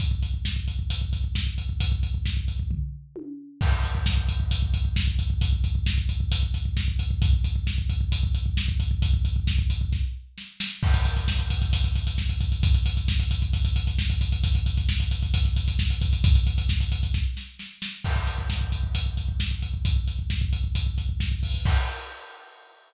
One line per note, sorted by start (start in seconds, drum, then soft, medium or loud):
0.00 kick medium
0.00 closed hi-hat medium
0.11 kick medium
0.23 kick medium
0.23 closed hi-hat medium
0.34 kick medium
0.45 kick medium
0.45 snare loud
0.56 kick medium
0.68 kick medium
0.68 closed hi-hat medium
0.79 kick medium
0.90 kick medium
0.90 closed hi-hat loud
1.02 kick medium
1.13 kick medium
1.13 closed hi-hat medium
1.24 kick medium
1.35 kick medium
1.35 snare loud
1.47 kick medium
1.58 kick medium
1.58 closed hi-hat medium
1.69 kick medium
1.80 kick medium
1.80 closed hi-hat loud
1.92 kick medium
2.03 kick medium
2.03 closed hi-hat medium
2.14 kick medium
2.26 kick medium
2.26 snare loud
2.37 kick medium
2.48 kick medium
2.48 closed hi-hat medium
2.59 kick medium
2.71 kick medium
2.71 floor tom medium
3.16 high tom medium
3.61 kick loud
3.61 crash loud
3.72 kick medium
3.83 kick medium
3.83 closed hi-hat medium
3.95 kick medium
4.06 kick medium
4.06 snare loud
4.17 kick medium
4.29 kick medium
4.29 closed hi-hat medium
4.40 kick medium
4.51 kick medium
4.51 closed hi-hat loud
4.62 kick medium
4.74 kick medium
4.74 closed hi-hat medium
4.85 kick medium
4.96 kick medium
4.96 snare loud
5.08 kick medium
5.19 kick medium
5.19 closed hi-hat medium
5.30 kick medium
5.41 kick loud
5.41 closed hi-hat loud
5.53 kick medium
5.64 kick medium
5.64 closed hi-hat medium
5.75 kick medium
5.86 kick medium
5.86 snare loud
5.98 kick medium
6.09 kick medium
6.09 closed hi-hat medium
6.20 kick medium
6.32 kick medium
6.32 closed hi-hat loud
6.43 kick medium
6.54 kick medium
6.54 closed hi-hat medium
6.65 kick medium
6.77 kick medium
6.77 snare loud
6.88 kick medium
6.99 kick medium
6.99 closed hi-hat medium
7.11 kick medium
7.22 kick loud
7.22 closed hi-hat loud
7.33 kick medium
7.44 kick medium
7.44 closed hi-hat medium
7.56 kick medium
7.67 kick medium
7.67 snare loud
7.78 kick medium
7.89 kick medium
7.89 closed hi-hat medium
8.01 kick medium
8.12 kick medium
8.12 closed hi-hat loud
8.23 kick medium
8.35 kick medium
8.35 closed hi-hat medium
8.46 kick medium
8.57 kick medium
8.57 snare loud
8.68 kick medium
8.80 kick medium
8.80 closed hi-hat medium
8.91 kick medium
9.02 kick loud
9.02 closed hi-hat loud
9.14 kick medium
9.25 kick medium
9.25 closed hi-hat medium
9.36 kick medium
9.47 kick medium
9.47 snare loud
9.59 kick medium
9.70 kick medium
9.70 closed hi-hat medium
9.81 kick medium
9.92 kick medium
9.92 snare medium
10.38 snare medium
10.60 snare loud
10.83 kick loud
10.83 crash loud
10.94 kick medium
10.94 closed hi-hat medium
11.05 kick medium
11.05 closed hi-hat medium
11.17 kick medium
11.17 closed hi-hat medium
11.28 kick medium
11.28 snare loud
11.39 kick medium
11.39 closed hi-hat medium
11.50 kick medium
11.50 closed hi-hat medium
11.62 kick medium
11.62 closed hi-hat medium
11.73 kick medium
11.73 closed hi-hat loud
11.84 kick medium
11.84 closed hi-hat medium
11.95 kick medium
11.95 closed hi-hat medium
12.07 kick medium
12.07 closed hi-hat medium
12.18 kick medium
12.18 snare medium
12.29 kick medium
12.29 closed hi-hat medium
12.41 kick medium
12.41 closed hi-hat medium
12.52 kick medium
12.52 closed hi-hat medium
12.63 kick loud
12.63 closed hi-hat loud
12.74 kick medium
12.74 closed hi-hat medium
12.86 kick medium
12.86 closed hi-hat medium
12.97 kick medium
12.97 closed hi-hat medium
13.08 kick medium
13.08 snare loud
13.20 kick medium
13.20 closed hi-hat medium
13.31 kick medium
13.31 closed hi-hat medium
13.42 kick medium
13.42 closed hi-hat medium
13.53 kick medium
13.53 closed hi-hat medium
13.65 kick medium
13.65 closed hi-hat medium
13.76 kick medium
13.76 closed hi-hat medium
13.87 kick medium
13.87 closed hi-hat medium
13.98 kick medium
13.98 snare loud
14.10 kick medium
14.10 closed hi-hat medium
14.21 kick medium
14.21 closed hi-hat medium
14.32 kick medium
14.32 closed hi-hat medium
14.44 kick loud
14.44 closed hi-hat loud
14.55 kick medium
14.55 closed hi-hat medium
14.66 kick medium
14.66 closed hi-hat medium
14.77 kick medium
14.77 closed hi-hat medium
14.89 kick medium
14.89 snare loud
15.00 kick medium
15.00 closed hi-hat medium
15.11 kick medium
15.11 closed hi-hat medium
15.23 kick medium
15.23 closed hi-hat medium
15.34 kick loud
15.34 closed hi-hat loud
15.45 kick medium
15.45 closed hi-hat medium
15.56 kick medium
15.56 closed hi-hat medium
15.68 kick medium
15.68 closed hi-hat medium
15.79 kick medium
15.79 snare loud
15.90 kick medium
15.90 closed hi-hat medium
16.01 kick loud
16.01 closed hi-hat medium
16.13 kick medium
16.13 closed hi-hat medium
16.24 kick loud
16.24 closed hi-hat loud
16.35 kick medium
16.35 closed hi-hat medium
16.47 kick medium
16.47 closed hi-hat medium
16.58 kick medium
16.58 closed hi-hat medium
16.69 kick medium
16.69 snare loud
16.80 kick medium
16.80 closed hi-hat medium
16.92 kick medium
16.92 closed hi-hat medium
17.03 kick medium
17.03 closed hi-hat medium
17.14 kick medium
17.14 snare medium
17.37 snare medium
17.59 snare medium
17.82 snare loud
18.05 kick medium
18.05 crash loud
18.16 kick medium
18.27 kick medium
18.27 closed hi-hat medium
18.38 kick medium
18.50 kick medium
18.50 snare loud
18.61 kick medium
18.72 kick medium
18.72 closed hi-hat medium
18.83 kick medium
18.95 kick medium
18.95 closed hi-hat loud
19.06 kick medium
19.17 kick medium
19.17 closed hi-hat medium
19.29 kick medium
19.40 kick medium
19.40 snare loud
19.51 kick medium
19.62 kick medium
19.62 closed hi-hat medium
19.74 kick medium
19.85 kick loud
19.85 closed hi-hat loud
19.96 kick medium
20.08 kick medium
20.08 closed hi-hat medium
20.19 kick medium
20.30 kick medium
20.30 snare loud
20.41 kick medium
20.53 kick medium
20.53 closed hi-hat medium
20.64 kick medium
20.75 kick medium
20.75 closed hi-hat loud
20.86 kick medium
20.98 kick medium
20.98 closed hi-hat medium
21.09 kick medium
21.20 kick medium
21.20 snare loud
21.32 kick medium
21.43 kick medium
21.43 open hi-hat medium
21.54 kick medium
21.65 kick loud
21.65 crash loud